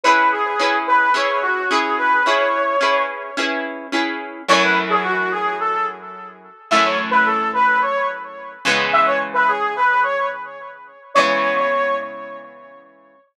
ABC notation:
X:1
M:4/4
L:1/16
Q:1/4=108
K:C#m
V:1 name="Brass Section"
B2 G4 B2 c2 F2 G2 B2 | c6 z10 | c B z G F2 G2 A2 z6 | e c z B A2 B2 c2 z6 |
e c z B G2 B2 c2 z6 | c6 z10 |]
V:2 name="Overdriven Guitar"
[CEGB]4 [CEGB]4 [CEGB]4 [CEGB]4 | [CEGB]4 [CEGB]4 [CEGB]4 [CEGB]4 | [F,,E,A,C]16 | [F,,E,A,C]14 [C,E,G,B,]2- |
[C,E,G,B,]16 | [C,E,G,B,]16 |]